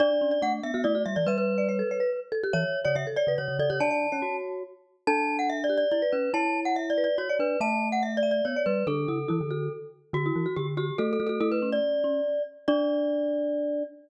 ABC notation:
X:1
M:3/4
L:1/16
Q:1/4=142
K:D
V:1 name="Glockenspiel"
d3 d f z e2 d2 e d | B B9 z2 | c3 c e z d2 c2 d c | a6 z6 |
a3 f (3e2 d2 d2 d2 B2 | a3 f (3e2 d2 d2 c2 B2 | a3 f (3e2 d2 d2 c2 B2 | A10 z2 |
F4 G z G2 (3A2 A2 A2 | A B2 d7 z2 | d12 |]
V:2 name="Marimba"
D z C z D3 F E F z2 | e3 d c A c B z2 A G | e3 d c A c B z2 A G | d d2 c5 z4 |
A6 G2 z B3 | c6 B2 z d3 | e6 e2 z d3 | D2 E z E z F2 z4 |
z E2 F z2 F z F2 F F | E2 C4 C2 z4 | D12 |]
V:3 name="Glockenspiel"
D4 A,2 B, B, A,2 G, E, | G,6 z6 | E, z2 C, C, z2 C, C, C, C, C, | D3 C F4 z4 |
D8 E z C2 | E8 F z D2 | A,8 B, z G,2 | D,2 C,2 E, D,3 z4 |
D,2 E, z D,4 A,2 A,2 | A,4 z8 | D12 |]